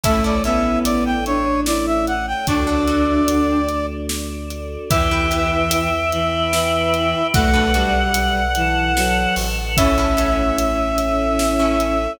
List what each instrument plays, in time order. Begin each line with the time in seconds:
0.04 synth bass 2 A1, choir aahs A3 C#4 E4, violin A3, orchestral harp C#4 E4 A4, brass section E5, kick, closed hi-hat
0.24 orchestral harp C#4 E4 A4, brass section D5
0.44 violin B3, orchestral harp C#4 E4 A4, brass section E5, closed hi-hat
0.85 synth bass 2 A1, brass section D5, closed hi-hat
1.06 brass section G5
1.26 violin D4, brass section C#5, closed hi-hat
1.66 violin E4, brass section D5, snare
1.86 brass section E5
2.07 brass section F#5, closed hi-hat
2.27 brass section G5
2.47 synth bass 2 D2, choir aahs A3 D4 F#4, violin D4, orchestral harp D4 F#4 A4, brass section D5, kick, closed hi-hat
2.67 orchestral harp D4 F#4 A4
2.88 orchestral harp D4 F#4 A4, closed hi-hat
3.28 synth bass 2 D2, closed hi-hat
3.69 closed hi-hat
4.09 snare
4.51 closed hi-hat
4.90 synth bass 2 E2, violin E3, orchestral harp E4 G4 B4, choir aahs B4 E5 G5, brass section E5, kick, closed hi-hat
5.11 orchestral harp E4 G4 B4
5.31 orchestral harp E4 G4 B4, closed hi-hat
5.71 closed hi-hat
6.12 violin E3, choir aahs B4 G5 B5, closed hi-hat
6.53 violin E3, snare
6.94 closed hi-hat
7.34 synth bass 2 B1, violin A3, orchestral harp D4 F#4 A4 B4, choir aahs A4 B4 D5 F#5, brass section F#5, kick, closed hi-hat
7.54 orchestral harp D4 F#4 A4 B4
7.74 violin G3, orchestral harp D4 F#4 A4 B4, closed hi-hat
8.14 closed hi-hat
8.55 violin E3, choir aahs A4 B4 F#5 A5, closed hi-hat
8.96 violin F#3, snare
9.36 synth bass 2 A1, open hi-hat
9.77 choir aahs A3 C#4 E4, violin C#4, orchestral harp C#4 E4 A4, brass section E5, kick, closed hi-hat
9.98 orchestral harp C#4 E4 A4
10.17 orchestral harp C#4 E4 A4, closed hi-hat
10.58 synth bass 2 A1, closed hi-hat
10.98 closed hi-hat
11.39 snare
11.59 orchestral harp C#4 E4 A4
11.80 closed hi-hat